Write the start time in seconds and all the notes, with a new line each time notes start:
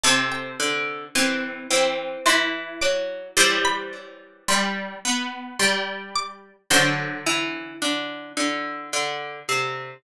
0.04 C3 C4 A4 A5
0.32 G5
0.60 D3
1.15 E3 C4 C6
1.71 E3 C4
2.26 E3 E4 C6
2.81 F#3 D6
3.37 E3 G3 C5 C6
3.65 B5
4.48 G3 C6
5.05 B3
5.59 G3 C6
6.16 D6
6.70 D3 F#3 C5 D5 F#5
7.27 E3
7.82 D3
8.37 D3
8.93 D3
9.49 C3